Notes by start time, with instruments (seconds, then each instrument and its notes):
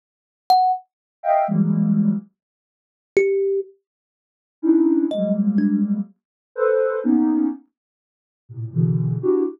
0.50 kalimba F#5
1.23 ocarina D#5 E5 F5 G5
1.47 ocarina E3 F#3 G3 G#3 A#3
3.17 kalimba G4
4.62 ocarina C#4 D4 D#4 E4
5.11 ocarina F#3 G3 G#3 A#3, kalimba D#5
5.58 kalimba D4
6.56 ocarina A4 B4 C5
7.04 ocarina A#3 B3 C#4 D#4
8.49 ocarina A2 A#2 C3
8.73 ocarina B2 C#3 D3 E3
9.22 ocarina D4 E4 F#4 G4